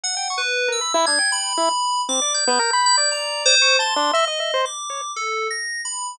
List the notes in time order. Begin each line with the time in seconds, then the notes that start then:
0.04 F#5
0.17 G5
0.30 C#6
0.38 B4
0.68 A#4 E6
0.81 B5
0.94 E4
1.06 D4 G#6
1.19 G5
1.32 B5
1.57 E4
2.09 C4 D6
2.22 D5
2.34 G6
2.47 B3
2.59 A#4
2.73 B5
2.86 G6
2.98 D5
3.12 A#5
3.46 C5
3.62 C#6
3.79 A5 C6
3.96 D4
4.13 D#5 E5
4.28 D#5
4.40 E5
4.54 C5
4.65 D6
4.90 C#5
5.16 A4
5.51 A#6
5.85 B5